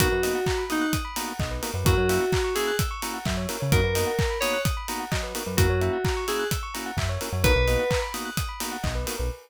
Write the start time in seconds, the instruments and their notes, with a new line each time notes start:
0.00 synth bass 1 B1, drawbar organ A#3 B3 D#4 F#4, electric piano 2 F#4, tubular bells A#4, kick, closed hi-hat
0.12 synth bass 1 F#2, tubular bells B4
0.23 drawbar organ A#3 B3 D#4 F#4, tubular bells D#5, open hi-hat
0.35 tubular bells F#5
0.46 tubular bells A#5, kick, clap
0.58 tubular bells B5
0.70 drawbar organ A#3 B3 D#4 F#4, electric piano 2 D#4, tubular bells D#6, open hi-hat
0.81 tubular bells F#6
0.93 tubular bells D#6, kick, closed hi-hat
1.05 tubular bells B5
1.16 drawbar organ A#3 B3 D#4 F#4, tubular bells A#5, open hi-hat
1.28 tubular bells F#5
1.40 synth bass 1 B1, tubular bells D#5, kick, clap
1.51 tubular bells B4
1.62 drawbar organ A#3 B3 D#4 F#4, tubular bells A#4, open hi-hat
1.74 synth bass 1 F#2, tubular bells B4
1.85 synth bass 1 F#2, drawbar organ A#3 C#4 E4 F#4, electric piano 2 F#4, tubular bells A#4, kick, closed hi-hat
1.97 synth bass 1 F#2, tubular bells C#5
2.09 drawbar organ A#3 C#4 E4 F#4, tubular bells E5, open hi-hat
2.21 tubular bells F#5
2.32 tubular bells A#5, kick, clap
2.44 tubular bells C#6
2.55 drawbar organ A#3 C#4 E4 F#4, electric piano 2 G#4, tubular bells E6, open hi-hat
2.67 tubular bells F#6
2.79 tubular bells E6, kick, closed hi-hat
2.91 tubular bells C#6
3.02 drawbar organ A#3 C#4 E4 F#4, tubular bells A#5, open hi-hat
3.14 tubular bells F#5
3.25 synth bass 1 F#2, tubular bells E5, kick, clap
3.37 tubular bells C#5
3.49 drawbar organ A#3 C#4 E4 F#4, tubular bells A#4, open hi-hat
3.60 synth bass 1 C#3, tubular bells C#5
3.72 synth bass 1 F#2, drawbar organ A#3 B3 D#4 F#4, electric piano 2 A#4, tubular bells A#4, kick, closed hi-hat
3.83 synth bass 1 F#2, tubular bells B4
3.95 drawbar organ A#3 B3 D#4 F#4, tubular bells D#5, open hi-hat
4.07 tubular bells F#5
4.19 tubular bells A#5, kick, clap
4.30 tubular bells B5
4.40 drawbar organ A#3 B3 D#4 F#4, electric piano 2 C#5, tubular bells D#6, open hi-hat
4.53 tubular bells F#6
4.65 tubular bells D#6, kick, closed hi-hat
4.77 tubular bells B5
4.88 drawbar organ A#3 B3 D#4 F#4, tubular bells A#5, open hi-hat
5.00 tubular bells F#5
5.12 synth bass 1 F#3, tubular bells D#5, kick, clap
5.23 tubular bells B4
5.35 drawbar organ A#3 B3 D#4 F#4, tubular bells A#4, open hi-hat
5.46 synth bass 1 F#2, tubular bells B4
5.57 synth bass 1 F#2, drawbar organ A#3 C#4 E4 F#4, electric piano 2 F#4, tubular bells A#4, kick, closed hi-hat
5.68 synth bass 1 F#2, tubular bells C#5
5.81 drawbar organ A#3 C#4 E4 F#4, tubular bells E5, closed hi-hat
5.93 tubular bells F#5
6.05 tubular bells A#5, kick, clap
6.17 tubular bells C#6
6.28 drawbar organ A#3 C#4 E4 F#4, electric piano 2 G#4, tubular bells E6, open hi-hat
6.39 tubular bells F#6
6.51 tubular bells E6, kick, closed hi-hat
6.63 tubular bells C#6
6.74 drawbar organ A#3 C#4 E4 F#4, tubular bells A#5, open hi-hat
6.86 tubular bells F#5
6.97 synth bass 1 F#2, tubular bells E5, kick, clap
7.09 tubular bells C#5
7.21 drawbar organ A#3 C#4 E4 F#4, tubular bells A#4, open hi-hat
7.33 synth bass 1 F#2, tubular bells C#5
7.44 synth bass 1 B1, drawbar organ A#3 B3 D#4 F#4, tubular bells A#4, electric piano 2 B4, kick, closed hi-hat
7.56 synth bass 1 B1, tubular bells B4
7.68 drawbar organ A#3 B3 D#4 F#4, tubular bells D#5, open hi-hat
7.79 tubular bells F#5
7.91 tubular bells A#5, kick, clap
8.02 tubular bells B5
8.14 drawbar organ A#3 B3 D#4 F#4, tubular bells D#6, open hi-hat
8.25 tubular bells F#6
8.37 tubular bells D#6, kick, closed hi-hat
8.49 tubular bells B5
8.60 drawbar organ A#3 B3 D#4 F#4, tubular bells A#5, open hi-hat
8.72 tubular bells F#5
8.83 synth bass 1 B1, tubular bells D#5, kick, clap
8.95 tubular bells B4
9.07 drawbar organ A#3 B3 D#4 F#4, tubular bells A#4, open hi-hat
9.18 synth bass 1 B1, tubular bells B4